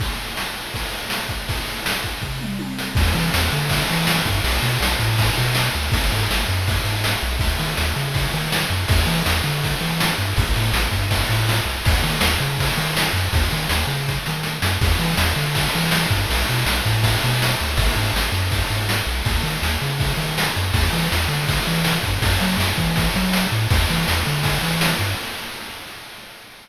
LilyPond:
<<
  \new Staff \with { instrumentName = "Synth Bass 1" } { \clef bass \time 4/4 \key e \major \tempo 4 = 162 r1 | r1 | e,8 e8 e,8 d4 e4 g,8 | b,,8 b,8 b,,8 a,4 b,4 d,8 |
gis,,8 gis,8 gis,,8 fis,4 gis,4 b,,8 | dis,8 dis8 dis,8 cis4 dis4 fis,8 | e,8 e8 e,8 d4 e4 g,8 | a,,8 a,8 a,,8 g,4 a,4 c,8 |
dis,8 dis8 dis,8 cis4 dis4 fis,8 | dis,8 dis8 dis,8 cis4 dis4 fis,8 | e,8 e8 e,8 d4 e4 g,8 | b,,8 b,8 b,,8 a,4 b,4 d,8 |
gis,,8 gis,8 gis,,8 fis,4 gis,4 b,,8 | dis,8 dis8 dis,8 cis4 dis4 fis,8 | e,8 e8 e,8 d4 e4 g,8 | fis,8 fis8 fis,8 e4 fis4 a,8 |
e,8 e8 e,8 d4 e4 g,8 | }
  \new DrumStaff \with { instrumentName = "Drums" } \drummode { \time 4/4 <cymc bd>4 sn8 cymr8 <bd cymr>8 cymr8 sn8 <bd cymr>8 | <bd cymr>8 cymr8 sn8 <bd cymr>8 <bd tomfh>8 toml8 tommh8 sn8 | <cymc bd>8 cymr8 sn8 cymr8 <bd cymr>8 cymr8 sn8 <bd cymr>8 | cymr8 cymr8 sn8 <bd cymr>8 <bd cymr>8 cymr8 sn8 cymr8 |
<bd cymr>8 cymr8 sn8 cymr8 <bd cymr>8 cymr8 sn8 cymr8 | <bd cymr>8 cymr8 sn8 cymr8 <bd cymr>8 cymr8 sn8 cymr8 | <bd cymr>8 cymr8 sn8 cymr8 <bd cymr>8 cymr8 sn8 cymr8 | <bd cymr>8 cymr8 sn8 <bd cymr>8 <bd cymr>8 cymr8 sn8 cymr8 |
<bd cymr>8 cymr8 sn8 cymr8 <bd cymr>8 cymr8 sn8 cymr8 | <bd cymr>8 cymr8 sn8 cymr8 <bd sn>8 sn8 sn8 sn8 | <cymc bd>8 cymr8 sn8 cymr8 <bd cymr>8 cymr8 sn8 <bd cymr>8 | cymr8 cymr8 sn8 <bd cymr>8 <bd cymr>8 cymr8 sn8 cymr8 |
<bd cymr>8 cymr8 sn8 cymr8 <bd cymr>8 cymr8 sn8 cymr8 | <bd cymr>8 cymr8 sn8 cymr8 <bd cymr>8 cymr8 sn8 cymr8 | <cymc bd>8 cymr8 sn8 cymr8 <bd cymr>8 cymr8 sn8 <bd cymr>8 | <bd cymr>8 cymr8 sn8 <bd cymr>8 <bd cymr>8 <bd cymr>8 sn8 cymr8 |
<bd cymr>8 cymr8 sn8 cymr8 <bd cymr>8 cymr8 sn8 cymr8 | }
>>